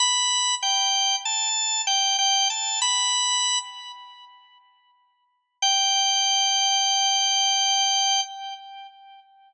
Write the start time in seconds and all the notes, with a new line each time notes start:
0.00 B5
0.62 G5
1.25 A5
1.87 G5
2.19 G5
2.50 A5
2.82 B5
5.62 G5